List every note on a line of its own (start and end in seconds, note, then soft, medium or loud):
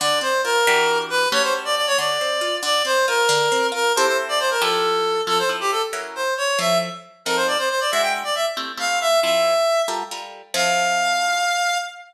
0.00 0.21 D3 loud
0.00 0.19 D5 medium
0.21 0.41 C4 medium
0.21 0.41 C5 medium
0.44 0.64 F4 medium
0.44 0.98 A#4 loud
0.67 1.27 E3 loud
0.67 1.27 D4 loud
0.67 1.27 F#4 loud
0.67 1.27 G4 loud
1.10 1.29 B4 loud
1.32 1.91 A3 loud
1.32 1.91 C#4 loud
1.32 1.91 F#4 loud
1.32 1.91 G4 loud
1.32 1.42 C#5 loud
1.43 1.53 C5 medium
1.65 1.75 D5 medium
1.76 1.86 D5 medium
1.87 1.97 C#5 loud
1.98 2.18 D3 loud
1.98 2.56 D5 medium
2.21 2.41 C4 medium
2.41 2.61 F4 medium
2.63 2.82 D3 loud
2.63 2.83 D5 loud
2.85 3.04 C4 medium
2.85 3.06 C5 medium
3.08 3.28 F4 medium
3.08 3.67 A#4 medium
3.29 3.49 D3 loud
3.52 3.72 C4 loud
3.72 3.92 F4 medium
3.72 3.92 A#4 medium
3.96 4.57 C4 loud
3.96 4.57 E4 loud
3.96 4.57 G4 loud
3.96 4.57 A4 loud
3.96 4.06 C5 medium
4.07 4.17 C5 medium
4.29 4.39 D5 medium
4.40 4.50 C5 medium
4.51 4.61 A#4 medium
4.61 5.21 F3 loud
4.61 5.21 E4 loud
4.61 5.21 G4 loud
4.61 5.21 A4 medium
4.61 5.21 A4 loud
5.27 5.42 F3 medium
5.27 5.42 C4 medium
5.27 5.42 E4 medium
5.27 5.42 A4 medium
5.27 5.38 A4 loud
5.39 5.49 C5 medium
5.49 5.80 F3 medium
5.49 5.80 C4 medium
5.49 5.80 E4 medium
5.49 5.80 A4 medium
5.60 5.71 G4 medium
5.72 5.82 A4 medium
5.93 6.24 F#3 medium
5.93 6.24 C#4 medium
5.93 6.24 E4 medium
5.93 6.24 A#4 medium
6.15 6.34 C5 medium
6.37 6.59 C#5 medium
6.59 6.89 F3 medium
6.59 6.89 C4 medium
6.59 6.89 E4 medium
6.59 6.89 A4 medium
6.59 6.78 E5 medium
7.25 7.57 F3 medium
7.25 7.57 C4 medium
7.25 7.57 D#4 medium
7.25 7.57 A4 medium
7.25 7.36 A#4 medium
7.36 7.47 C5 medium
7.47 7.58 D5 medium
7.58 7.69 C5 medium
7.69 7.80 C5 medium
7.80 7.91 D5 medium
7.91 8.24 G#3 medium
7.91 8.24 D4 medium
7.91 8.24 E4 medium
7.91 8.24 F#4 medium
7.91 8.02 E5 medium
8.02 8.13 G5 medium
8.24 8.35 D5 medium
8.35 8.46 E5 medium
8.57 8.72 A3 medium
8.57 8.72 C4 medium
8.57 8.72 E4 medium
8.57 8.72 G4 medium
8.77 9.08 A3 medium
8.77 9.08 C4 medium
8.77 9.08 E4 medium
8.77 9.08 G4 medium
8.77 8.99 F5 medium
9.01 9.20 E5 loud
9.23 9.54 F3 medium
9.23 9.54 C4 medium
9.23 9.54 E4 medium
9.23 9.54 A4 medium
9.23 9.82 E5 medium
9.88 10.03 G3 medium
9.88 10.03 F4 medium
9.88 10.03 A4 medium
9.88 10.03 A#4 medium
10.11 10.42 G3 medium
10.11 10.42 F4 medium
10.11 10.42 A4 medium
10.11 10.42 A#4 medium
10.54 11.77 F3 loud
10.54 11.77 C4 medium
10.54 11.77 E4 medium
10.54 11.77 A4 medium
10.54 11.78 F5 loud